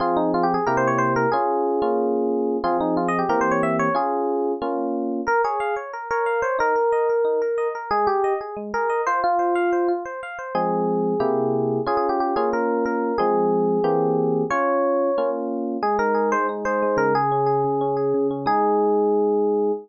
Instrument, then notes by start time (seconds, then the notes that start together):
electric piano 1
0.00 F3 C4 F4 G#4
0.17 D#4
0.34 F4
0.43 G4
0.54 G#4
0.66 C3 A#3 E4 G4 A#4
0.77 C5
0.87 C#5
0.98 C5
1.16 A#4
1.32 C#4 F4 G#4
1.82 A#3 C#4 F4
2.64 F3 C4 F4 G#4
2.80 D#4
2.97 F4
3.08 D#5
3.19 G4
3.29 E3 A#3 C4 G4 A#4
3.41 C5
3.51 C#5
3.63 E5
3.79 C#5
3.95 C#4 F4 G#4
4.62 A#3 C#4 F4
5.27 A#4
5.44 G#4 C#5
5.60 F5
5.76 C#5
5.93 A#4
6.11 A#4 C#5
6.26 F5
6.42 C5 C#5
6.59 D#4 A#4
6.76 A#4
6.92 D#5
7.09 A#4
7.25 D#4
7.42 A#4
7.58 D#5
7.75 A#4
7.91 G#3 G#4
8.07 G4 G#4
8.24 D#5
8.41 G#4
8.57 G#3
8.74 G#4 A#4
8.90 D#5
9.07 F4 C5
9.24 F4
9.39 C5
9.55 F5
9.73 C5
9.88 F4
10.05 C5
10.23 F5
10.39 C5
10.55 F3 G#3 C4 G#4
11.20 C3 A#3 E4 G4
11.86 C#4 F4 G#4
11.97 G#4
12.09 G4
12.20 G4
12.36 A#3 C#4 F4 G#4
12.53 A#4
12.86 A#4
13.18 F3 G#3 C4 G#4
13.84 E3 A#3 C4 G4
14.50 C#4 F4 C#5
15.18 A#3 C#4 F4
15.82 G#3 G#4
15.99 D#4 A#4
16.14 G#4
16.32 G#3 C5
16.49 D#4
16.65 G#4 C5
16.82 G#3
16.97 C#3 A#4
17.15 G#4
17.32 C#4
17.46 G#4
17.64 C#3
17.81 C#4
17.97 G#4
18.14 C#3
18.31 C#4
18.46 G#3 D#4 G#4